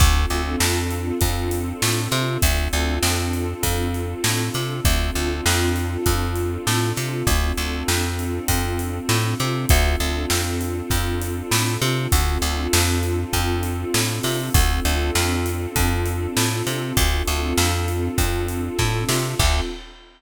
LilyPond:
<<
  \new Staff \with { instrumentName = "Pad 2 (warm)" } { \time 4/4 \key d \dorian \tempo 4 = 99 <c' d' f' a'>1 | <c' d' f' a'>1 | <c' d' f' a'>1 | <c' d' f' a'>1 |
<c' d' f' a'>1 | <c' d' f' a'>1 | <c' d' f' a'>1 | <c' d' f' a'>1 |
<c' d' f' a'>4 r2. | }
  \new Staff \with { instrumentName = "Electric Bass (finger)" } { \clef bass \time 4/4 \key d \dorian d,8 d,8 f,4 f,4 a,8 c8 | d,8 d,8 f,4 f,4 a,8 c8 | d,8 d,8 f,4 f,4 a,8 c8 | d,8 d,8 f,4 f,4 a,8 c8 |
d,8 d,8 f,4 f,4 a,8 c8 | d,8 d,8 f,4 f,4 a,8 c8 | d,8 d,8 f,4 f,4 a,8 c8 | d,8 d,8 f,4 f,4 a,8 c8 |
d,4 r2. | }
  \new DrumStaff \with { instrumentName = "Drums" } \drummode { \time 4/4 <hh bd>8 hh8 sn8 hh8 <hh bd>8 hh8 sn8 <hh sn>8 | <hh bd>8 hh8 sn8 hh8 <hh bd>8 hh8 sn8 <hh sn>8 | <hh bd>8 hh8 sn8 <hh sn>8 <hh bd>8 hh8 sn8 <hh sn>8 | <hh bd>8 hh8 sn8 hh8 <hh bd>8 hh8 sn8 <hh sn>8 |
<hh bd>8 hh8 sn8 hh8 <hh bd>8 hh8 sn8 <hh sn>8 | <hh bd>8 hh8 sn8 hh8 <hh bd>8 hh8 sn8 <hho sn>8 | <hh bd>8 hh8 sn8 hh8 <hh bd>8 hh8 sn8 <hh sn>8 | <hh bd>8 <hh sn>8 sn8 hh8 <hh bd>8 hh8 <bd sn>8 sn8 |
<cymc bd>4 r4 r4 r4 | }
>>